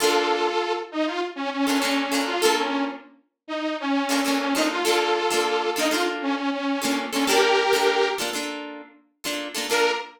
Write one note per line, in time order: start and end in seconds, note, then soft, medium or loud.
0.00 0.49 A#3 loud
0.00 0.49 D4 loud
0.00 0.73 F4 medium
0.00 0.49 F4 loud
0.00 0.73 A4 medium
0.00 0.49 A4 loud
0.92 1.06 D#4 medium
1.06 1.21 F4 medium
1.36 1.50 C#4 medium
1.52 1.66 C#4 medium
1.67 1.79 A#3 medium
1.67 2.21 C#4 medium
1.67 1.79 D4 loud
1.67 1.79 F4 medium
1.67 1.79 A4 medium
1.82 2.06 A#3 loud
1.82 2.06 D4 medium
1.82 2.06 F4 medium
1.82 2.06 A4 loud
2.12 2.36 A#3 medium
2.12 2.36 D4 loud
2.12 2.36 F4 medium
2.12 2.36 A4 loud
2.27 2.41 F4 medium
2.41 2.91 D4 loud
2.41 2.91 F4 loud
2.41 2.55 A4 medium
2.41 2.91 A4 loud
2.45 2.91 A#3 loud
2.58 2.84 C#4 medium
3.48 3.77 D#4 medium
3.80 4.24 C#4 medium
4.09 4.21 A#3 loud
4.09 4.21 D4 loud
4.09 4.21 F4 medium
4.09 4.21 A4 medium
4.25 4.49 A#3 medium
4.25 4.39 C#4 medium
4.25 4.49 D4 medium
4.25 4.49 F4 medium
4.25 4.49 A4 medium
4.40 4.54 C#4 medium
4.54 4.79 A#3 medium
4.54 4.79 D4 medium
4.54 4.69 D#4 medium
4.54 4.79 F4 medium
4.54 4.79 A4 loud
4.71 4.84 F4 medium
4.85 5.21 A#3 loud
4.85 5.21 D4 loud
4.85 5.70 F4 medium
4.85 5.21 F4 loud
4.85 5.21 A4 loud
4.85 5.70 A4 medium
5.30 5.67 A#3 loud
5.30 5.67 D4 loud
5.30 5.67 F4 loud
5.30 5.67 A4 medium
5.76 5.88 A#3 loud
5.76 5.88 D4 loud
5.76 5.92 D#4 medium
5.76 5.88 F4 loud
5.76 5.88 A4 loud
5.90 6.40 A#3 medium
5.90 6.40 D4 medium
5.90 6.05 F4 medium
5.90 6.40 F4 loud
5.90 6.40 A4 loud
6.22 6.35 C#4 medium
6.36 6.50 C#4 medium
6.52 7.04 C#4 medium
6.82 7.06 A#3 loud
6.82 7.06 D4 loud
6.82 7.06 F4 medium
6.82 7.06 A4 medium
7.12 7.25 A#3 medium
7.12 7.26 C#4 medium
7.12 7.25 D4 medium
7.12 7.25 F4 medium
7.12 7.25 A4 medium
7.27 7.64 A#3 loud
7.27 7.64 D4 loud
7.27 7.64 F4 loud
7.27 8.09 G4 medium
7.27 7.64 A4 loud
7.27 8.09 A#4 medium
7.73 8.09 A#3 medium
7.73 8.09 D4 medium
7.73 8.09 F4 medium
7.73 8.09 A4 medium
8.18 8.30 A#3 loud
8.18 8.30 D4 medium
8.18 8.30 F4 medium
8.18 8.30 A4 medium
8.33 8.82 A#3 medium
8.33 8.82 D4 medium
8.33 8.82 F4 medium
8.33 8.82 A4 medium
9.24 9.48 A#3 medium
9.24 9.48 D4 medium
9.24 9.48 F4 loud
9.24 9.48 A4 medium
9.55 9.67 A#3 loud
9.55 9.67 D4 medium
9.55 9.67 F4 medium
9.55 9.67 A4 loud
9.70 9.91 A#3 loud
9.70 9.91 D4 loud
9.70 9.91 F4 loud
9.70 9.91 A4 medium
9.70 9.91 A#4 loud